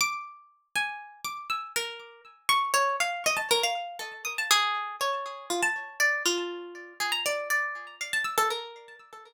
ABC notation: X:1
M:3/4
L:1/16
Q:1/4=120
K:none
V:1 name="Orchestral Harp"
d'6 _a4 d'2 | e'2 _B4 z2 _d'2 _d2 | f2 _e a _B f3 A2 _e' a | _A4 _d4 F =a3 |
d2 F6 _A _b d2 | d4 f a e' A _B4 |]